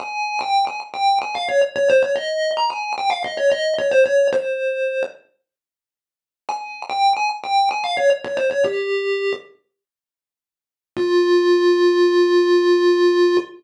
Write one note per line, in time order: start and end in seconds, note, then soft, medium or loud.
0.00 0.39 G#5 loud
0.41 0.65 G5 loud
0.67 0.80 G#5 loud
0.94 1.19 G5 medium
1.22 1.35 G#5 loud
1.35 1.48 F5 medium
1.49 1.61 C#5 medium
1.76 1.89 C#5 medium
1.90 2.02 C5 medium
2.03 2.16 C#5 loud
2.16 2.51 D#5 medium
2.57 2.70 A#5 medium
2.70 2.93 G#5 loud
2.98 3.11 G5 medium
3.10 3.23 F5 medium
3.24 3.37 D#5 loud
3.37 3.50 C#5 medium
3.52 3.74 D#5 medium
3.78 3.91 C#5 medium
3.91 4.04 C5 medium
4.06 4.27 C#5 medium
4.33 5.03 C5 loud
6.49 6.82 G#5 loud
6.90 7.13 G5 medium
7.17 7.29 G#5 medium
7.44 7.69 G5 medium
7.71 7.84 G#5 medium
7.84 7.97 F5 medium
7.97 8.10 C#5 medium
8.24 8.37 C#5 loud
8.37 8.50 C5 loud
8.51 8.64 C#5 medium
8.64 9.33 G4 loud
10.97 13.37 F4 loud